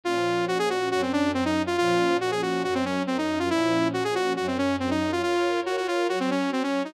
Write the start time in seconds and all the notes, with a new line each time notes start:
0.04 A#2 F3 C#4 F4
0.48 F#4
0.59 G#4
0.70 F#4
0.90 F#2 F#3 C#4 F#4
1.02 C4
1.13 D4
1.34 C4
1.45 D#4
1.67 F4
1.78 A#2 F3 C#4 F4
2.21 F#4
2.31 G#4
2.42 F#4
2.64 F#2 F#3 C#4 F#4
2.74 C4
2.85 C#4
3.07 C4
3.18 D#4
3.39 F4
3.49 A#2 F3 C#4 E4
3.93 F#4
4.04 G#4
4.15 F#4
4.36 F#2 F#3 C#4 F#4
4.47 C4
4.58 C#4
4.80 C4
4.90 D#4
5.12 F4
5.23 F4 A#4 C#5
5.66 F#4
5.77 F#4
5.88 F4
6.08 F#3 F#4 C#5
6.20 C4
6.31 C#4
6.52 C4
6.63 C#4
6.85 D#4